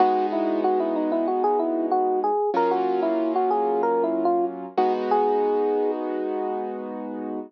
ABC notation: X:1
M:4/4
L:1/16
Q:1/4=94
K:G#m
V:1 name="Electric Piano 1"
F2 E2 F E D E F G E2 F2 G2 | A F2 E2 F G2 (3A2 E2 ^E2 z2 F z | G6 z10 |]
V:2 name="Acoustic Grand Piano"
[G,B,DF]16 | [F,A,C^E]14 [G,B,DF]2- | [G,B,DF]16 |]